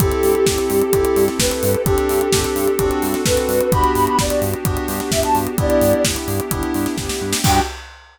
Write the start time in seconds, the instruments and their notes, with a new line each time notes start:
0.00 synth bass 1 G1, electric piano 2 C4 E4 G4 A4, pad 2 (warm) C4 E4 G4 A4, ocarina G4, kick, closed hi-hat
0.12 closed hi-hat
0.23 synth bass 1 G2, open hi-hat
0.35 closed hi-hat
0.46 synth bass 1 G1, kick, snare
0.58 closed hi-hat
0.70 synth bass 1 G2, open hi-hat
0.81 closed hi-hat
0.93 synth bass 1 G1, electric piano 2 C4 E4 G4 A4, kick, closed hi-hat
1.05 closed hi-hat
1.16 synth bass 1 G2, open hi-hat
1.28 snare, closed hi-hat
1.39 synth bass 1 G1, ocarina B4, kick, snare
1.51 closed hi-hat
1.63 synth bass 1 G2, open hi-hat
1.74 closed hi-hat
1.85 synth bass 1 G1, pad 2 (warm) C4 D4 G4 A4, electric piano 2 C4 D4 G4 A4, ocarina G4, kick, closed hi-hat
1.98 closed hi-hat
2.09 synth bass 1 G2, open hi-hat
2.21 closed hi-hat
2.33 synth bass 1 G1, electric piano 2 C4 D4 G4 A4, kick, snare
2.44 closed hi-hat
2.56 synth bass 1 G2, open hi-hat
2.67 closed hi-hat
2.79 synth bass 1 G1, pad 2 (warm) C4 D4 F#4 A4, electric piano 2 C4 D4 F#4 A4, kick, closed hi-hat
2.91 closed hi-hat
3.02 synth bass 1 G2, open hi-hat
3.14 snare, closed hi-hat
3.25 synth bass 1 G1, electric piano 2 C4 D4 F#4 A4, ocarina B4, kick, snare
3.37 closed hi-hat
3.48 synth bass 1 G2, open hi-hat
3.60 closed hi-hat
3.72 synth bass 1 G1, electric piano 2 B3 D4 F#4 G4, pad 2 (warm) B3 D4 F#4 G4, ocarina B5, kick, closed hi-hat
3.84 closed hi-hat
3.94 synth bass 1 G2, ocarina B5, open hi-hat
4.06 ocarina B5, closed hi-hat
4.18 synth bass 1 G1, ocarina D5, kick, snare
4.30 closed hi-hat
4.42 synth bass 1 G2, open hi-hat
4.53 closed hi-hat
4.65 synth bass 1 G1, electric piano 2 B3 D4 F#4 G4, kick, closed hi-hat
4.77 closed hi-hat
4.88 synth bass 1 G2, open hi-hat
5.00 snare, closed hi-hat
5.11 synth bass 1 G1, ocarina E5, kick, snare
5.23 ocarina A5, closed hi-hat
5.35 synth bass 1 G2, open hi-hat
5.47 closed hi-hat
5.58 synth bass 1 G1, pad 2 (warm) B3 D4 E4 G4, electric piano 2 B3 D4 E4 G4, ocarina D5, kick, closed hi-hat
5.70 closed hi-hat
5.81 synth bass 1 G2, open hi-hat
5.93 closed hi-hat
6.04 synth bass 1 G1, kick, snare
6.16 closed hi-hat
6.28 synth bass 1 G2, open hi-hat
6.40 closed hi-hat
6.51 synth bass 1 G1, electric piano 2 B3 D4 E4 G4, kick, closed hi-hat
6.63 closed hi-hat
6.74 synth bass 1 G2, open hi-hat
6.86 snare, closed hi-hat
6.98 synth bass 1 G1, kick, snare
7.09 snare
7.21 synth bass 1 G2
7.33 snare
7.44 synth bass 1 G2, pad 2 (warm) B3 D4 F#4 G4, electric piano 2 B3 D4 F#4 G4, ocarina G5, kick, crash